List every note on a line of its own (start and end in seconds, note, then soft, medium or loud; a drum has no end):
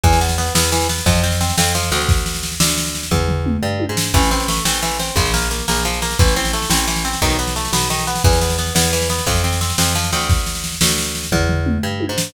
0.03 0.50 E2 medium
0.03 0.19 E3 medium
0.03 kick loud
0.03 snare medium
0.13 snare medium
0.21 0.36 B3 medium
0.21 snare medium
0.29 snare medium
0.38 0.53 B3 medium
0.38 snare medium
0.47 snare medium
0.55 1.01 E2 medium
0.55 0.71 B3 medium
0.55 snare loud
0.64 snare medium
0.72 0.88 E3 medium
0.72 snare loud
0.81 snare medium
0.89 1.05 B3 medium
0.89 snare loud
0.98 snare medium
1.06 1.52 F2 medium
1.06 1.22 F3 medium
1.06 kick loud
1.06 snare loud
1.15 snare medium
1.24 1.39 C4 medium
1.24 snare medium
1.32 snare medium
1.41 1.56 C4 medium
1.41 snare loud
1.49 snare medium
1.58 1.91 F2 medium
1.58 1.73 C4 medium
1.58 snare loud
1.66 snare medium
1.75 1.90 F3 medium
1.75 snare medium
1.83 snare medium
1.92 2.55 D2 medium
1.92 2.07 C4 medium
1.92 snare medium
2.00 snare medium
2.09 kick loud
2.09 snare medium
2.17 snare medium
2.26 snare medium
2.34 snare medium
2.43 snare medium
2.52 snare medium
2.60 3.06 D2 medium
2.60 snare loud
2.69 snare medium
2.78 snare loud
2.86 snare medium
2.95 snare medium
3.03 snare medium
3.11 3.57 E2 medium
3.11 kick medium
3.11 floor tom medium
3.28 floor tom medium
3.46 mid tom medium
3.63 3.86 G2 medium
3.80 high tom loud
3.89 4.12 G#2 medium
3.97 snare loud
4.14 4.60 A1 medium
4.14 4.29 E3 medium
4.14 kick loud
4.14 snare medium
4.23 snare medium
4.31 4.47 C4 medium
4.31 snare medium
4.40 snare medium
4.48 4.64 A3 medium
4.48 snare loud
4.57 snare medium
4.65 5.11 A1 medium
4.65 4.81 C4 medium
4.65 snare loud
4.74 snare medium
4.82 4.98 E3 medium
4.82 snare medium
4.91 snare medium
4.99 5.15 C4 medium
4.99 snare medium
5.08 snare medium
5.16 5.62 A#1 medium
5.16 5.32 F3 medium
5.16 kick loud
5.16 snare medium
5.25 snare medium
5.34 5.49 A#3 medium
5.34 snare loud
5.42 snare medium
5.51 5.66 A#3 medium
5.51 snare medium
5.59 snare medium
5.68 6.15 A#1 medium
5.68 5.83 A#3 medium
5.68 snare loud
5.76 snare medium
5.85 6.00 F3 medium
5.85 snare medium
5.93 snare medium
6.02 6.18 A#3 medium
6.02 snare medium
6.11 snare medium
6.19 6.66 A1 medium
6.19 6.35 E3 medium
6.19 kick loud
6.19 snare medium
6.28 snare medium
6.36 6.52 C4 medium
6.36 snare medium
6.45 snare medium
6.53 6.69 A3 medium
6.53 snare medium
6.62 snare medium
6.70 7.16 A1 medium
6.70 6.86 C4 medium
6.70 snare loud
6.79 snare medium
6.88 7.03 E3 medium
6.88 snare medium
6.96 snare medium
7.05 7.20 C4 medium
7.05 snare medium
7.13 snare medium
7.22 7.68 B1 medium
7.22 7.37 D#3 loud
7.22 kick medium
7.22 snare medium
7.30 snare medium
7.39 7.54 B3 medium
7.39 snare medium
7.47 snare medium
7.56 7.71 A3 medium
7.56 snare medium
7.65 snare medium
7.72 8.19 B1 medium
7.72 7.88 B3 medium
7.72 snare loud
7.82 snare medium
7.90 8.06 D#3 medium
7.90 snare loud
7.99 snare medium
8.07 8.23 B3 medium
8.07 snare medium
8.15 snare medium
8.24 8.71 E2 medium
8.24 8.40 E3 medium
8.24 kick loud
8.24 snare medium
8.33 snare medium
8.41 8.57 B3 medium
8.41 snare medium
8.50 snare medium
8.58 8.74 B3 medium
8.58 snare medium
8.67 snare medium
8.75 9.21 E2 medium
8.75 8.91 B3 medium
8.75 snare loud
8.84 snare medium
8.93 9.08 E3 medium
8.93 snare loud
9.01 snare medium
9.09 9.25 B3 medium
9.09 snare loud
9.19 snare medium
9.26 9.73 F2 medium
9.26 9.42 F3 medium
9.26 kick loud
9.26 snare loud
9.35 snare medium
9.44 9.59 C4 medium
9.44 snare medium
9.52 snare medium
9.61 9.76 C4 medium
9.61 snare loud
9.70 snare medium
9.78 10.11 F2 medium
9.78 9.94 C4 medium
9.78 snare loud
9.86 snare medium
9.95 10.11 F3 medium
9.95 snare medium
10.04 snare medium
10.12 10.76 D2 medium
10.12 10.28 C4 medium
10.12 snare medium
10.21 snare medium
10.29 kick loud
10.29 snare medium
10.38 snare medium
10.46 snare medium
10.55 snare medium
10.64 snare medium
10.72 snare medium
10.81 11.27 D2 medium
10.81 snare loud
10.89 snare medium
10.98 snare loud
11.06 snare medium
11.15 snare medium
11.23 snare medium
11.32 11.78 E2 medium
11.32 kick medium
11.32 floor tom medium
11.49 floor tom medium
11.66 mid tom medium
11.83 12.06 G2 medium
12.00 high tom loud
12.09 12.32 G#2 medium
12.18 snare loud